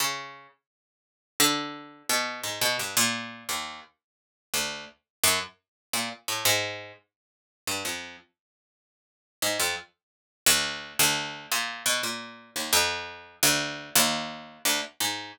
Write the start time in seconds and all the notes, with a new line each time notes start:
0.00 C#3
1.40 D3
2.09 B2
2.43 G#2
2.61 B2
2.79 G2
2.97 A#2
3.49 D#2
4.54 D2
5.24 F#2
5.93 A#2
6.28 A2
6.45 G#2
7.67 G2
7.85 F2
9.42 G#2
9.60 F2
10.46 D2
10.99 D2
11.52 A#2
11.86 B2
12.03 A#2
12.56 D#2
12.73 F2
13.43 D2
13.95 D#2
14.65 D2
15.00 G#2